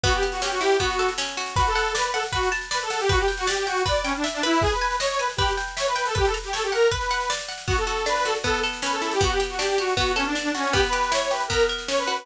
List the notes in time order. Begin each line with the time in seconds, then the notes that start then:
0.04 B3 F#4, kick, snare
0.12 G4, snare
0.23 G4, snare
0.32 F#4, snare
0.42 C#4 G4, snare
0.51 F#4, snare
0.61 E4 G4, snare
0.70 snare
0.79 B3 F#4, kick, snare
0.90 snare
0.99 A4, snare
1.09 snare
1.18 C#4, snare
1.28 snare
1.37 F#4, snare
1.46 snare
1.56 F#4 B4, kick, snare
1.67 A4, snare
1.75 F#5, snare
1.85 snare
1.95 B4 D5, snare
2.04 B4, snare
2.14 A4 F#5, snare
2.23 snare
2.31 F#4 B4, kick, snare
2.43 snare
2.52 A5, snare
2.61 snare
2.71 B4 D5, snare
2.81 A4, snare
2.90 A4 F#5, snare
2.99 G4, snare
3.09 F#4 B4, kick, snare
3.18 G4, snare
3.28 G5, snare
3.37 F#4, snare
3.47 G4 D5, snare
3.57 G4, snare
3.66 F#4 G5, snare
3.76 snare
3.86 B4 D5, kick, snare
3.95 snare
4.04 C#4 G5, snare
4.15 D4, snare
4.24 E5, snare
4.33 D4, snare
4.43 E4 B4, snare
4.52 snare
4.61 G#4, kick, snare
4.71 B4, snare
4.81 G#5, snare
4.91 snare
5.00 C#5 D#5, snare
5.09 C#5, snare
5.19 B4 G#5, snare
5.29 snare
5.37 G4 B4, kick, snare
5.48 snare
5.57 G5, snare
5.68 snare
5.77 C#5 E5, snare
5.86 B4, snare
5.96 B4 G5, snare
6.05 A4, snare
6.15 G4 B4, kick, snare
6.25 A4, snare
6.34 A#5, snare
6.44 G4, snare
6.53 A4 C#5, snare
6.63 G4, snare
6.72 A#4 F#5, snare
6.82 snare
6.91 B4, kick, snare
7.01 snare
7.10 F#5, snare
7.20 snare
7.30 D5, snare
7.39 snare
7.48 F#5, snare
7.58 snare
7.67 B3 F#4, kick, snare
7.77 A4, snare
7.87 F#4, snare
7.97 snare
8.06 D4 B4, snare
8.16 B4, snare
8.25 F#4 A4, snare
8.35 snare
8.44 B3 A4, kick, snare
8.54 snare
8.63 A4, snare
8.73 snare
8.82 C#4 B4, snare
8.92 A4, snare
9.02 E4 A4, snare
9.11 G4, snare
9.21 B3 F#4, kick, snare
9.30 G4, snare
9.40 G4, snare
9.50 F#4, snare
9.59 D4 G4, snare
9.69 G4, snare
9.78 F#4 G4, snare
9.88 snare
9.95 B3 F#4, kick, snare
10.06 snare
10.15 C#4 A4, snare
10.25 D4, snare
10.35 D4, snare
10.43 D4, snare
10.54 C#4 F#4, snare
10.63 snare
10.72 B3 G4, kick, snare
10.83 B4, snare
10.92 G4, snare
11.03 snare
11.12 E4 C#5, snare
11.22 C#5, snare
11.31 G4 B4, snare
11.40 snare
11.48 B3 A#4, kick, snare
11.60 snare
11.68 A#4, snare
11.78 snare
11.88 C#4 C#5, snare
11.98 B4, snare
12.07 F#4 B4, snare
12.16 B4, snare